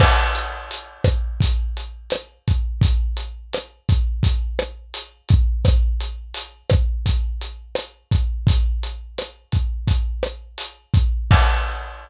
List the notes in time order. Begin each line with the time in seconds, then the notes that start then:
0.00 kick, cross-stick, crash
0.35 closed hi-hat
0.71 closed hi-hat
1.04 kick, cross-stick, closed hi-hat
1.40 kick, closed hi-hat
1.77 closed hi-hat
2.10 cross-stick, closed hi-hat
2.48 kick, closed hi-hat
2.81 kick, closed hi-hat
3.17 closed hi-hat
3.53 cross-stick, closed hi-hat
3.89 kick, closed hi-hat
4.23 kick, closed hi-hat
4.59 cross-stick, closed hi-hat
4.94 closed hi-hat
5.29 kick, closed hi-hat
5.65 kick, cross-stick, closed hi-hat
6.00 closed hi-hat
6.34 closed hi-hat
6.70 kick, cross-stick, closed hi-hat
7.06 kick, closed hi-hat
7.41 closed hi-hat
7.75 cross-stick, closed hi-hat
8.11 kick, closed hi-hat
8.47 kick, closed hi-hat
8.83 closed hi-hat
9.18 cross-stick, closed hi-hat
9.52 kick, closed hi-hat
9.87 kick, closed hi-hat
10.23 cross-stick, closed hi-hat
10.58 closed hi-hat
10.94 kick, closed hi-hat
11.31 kick, crash